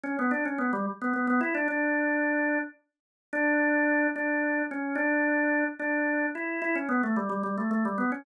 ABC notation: X:1
M:6/8
L:1/16
Q:3/8=73
K:D
V:1 name="Drawbar Organ"
C B, D C B, G, z B, B, B, E D | D8 z4 | D6 D4 C2 | D6 D4 E2 |
E C B, A, G, G, G, A, A, G, B, C |]